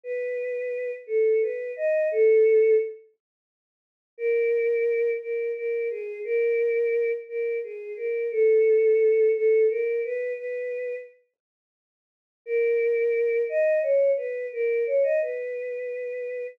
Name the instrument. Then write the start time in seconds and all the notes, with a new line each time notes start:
choir aahs
0.04 B4
1.07 A4
1.42 B4
1.76 D#5
2.11 A4
4.18 A#4
5.21 A#4
5.55 A#4
5.90 G#4
6.24 A#4
7.29 A#4
7.64 G#4
7.96 A#4
8.31 A4
9.35 A4
9.70 A#4
10.04 B4
10.37 B4
12.46 A#4
13.49 D#5
13.82 C#5
14.17 B4
14.52 A#4
14.86 C#5
15.03 D#5
15.22 B4